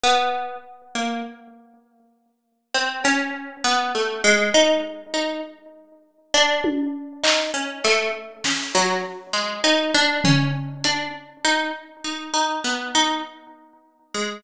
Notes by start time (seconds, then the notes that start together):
0.04 B3
0.95 A#3
2.75 C4
3.04 C#4, cowbell
3.64 B3
3.95 A3
4.24 G#3
4.54 D#4
5.14 D#4
6.34 D4
6.64 high tom
7.24 D#4, clap
7.54 C#4
7.84 A3, clap
8.44 C#4, snare
8.75 F#3
9.33 G#3
9.64 D#4, cowbell
9.95 D4
10.24 C#4, floor tom
10.84 D4, closed hi-hat
11.45 D#4
12.04 D#4
12.34 D#4
12.64 B3
12.95 D#4
14.14 G#3